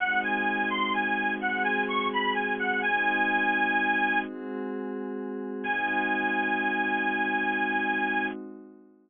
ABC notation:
X:1
M:12/8
L:1/8
Q:3/8=85
K:Ab
V:1 name="Harmonica"
_g a2 c' a2 g a d' =b a g | a6 z6 | a12 |]
V:2 name="Pad 5 (bowed)"
[A,CE_G]6 [A,CGA]6 | [A,CE_G]6 [A,CGA]6 | [A,CE_G]12 |]